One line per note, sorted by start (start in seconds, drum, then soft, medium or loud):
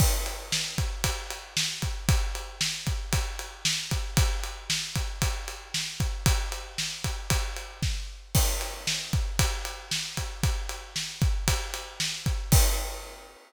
0.00 kick medium
0.00 crash medium
0.26 ride medium
0.52 snare loud
0.78 kick medium
0.78 ride medium
1.04 kick medium
1.04 ride medium
1.30 ride medium
1.57 snare loud
1.82 kick medium
1.82 ride medium
2.09 kick medium
2.09 ride medium
2.35 ride medium
2.61 snare loud
2.87 kick medium
2.87 ride medium
3.13 kick medium
3.13 ride medium
3.39 ride medium
3.65 snare loud
3.91 kick medium
3.91 ride medium
4.17 kick medium
4.17 ride medium
4.44 ride medium
4.70 snare loud
4.96 kick medium
4.96 ride medium
5.22 kick medium
5.22 ride medium
5.48 ride medium
5.74 snare medium
6.00 kick medium
6.00 ride medium
6.26 kick medium
6.26 ride loud
6.52 ride medium
6.78 snare medium
7.04 kick medium
7.04 ride medium
7.30 kick medium
7.30 ride medium
7.57 ride medium
7.82 kick medium
7.82 snare medium
8.35 kick medium
8.35 crash loud
8.61 ride medium
8.87 snare loud
9.13 kick medium
9.13 ride medium
9.39 kick medium
9.39 ride loud
9.65 ride medium
9.91 snare medium
10.17 kick medium
10.17 ride medium
10.43 kick medium
10.43 ride medium
10.69 ride medium
10.96 snare medium
11.22 kick medium
11.22 ride medium
11.48 kick medium
11.48 ride loud
11.74 ride medium
12.00 snare medium
12.26 kick medium
12.26 ride medium
12.52 kick loud
12.52 crash loud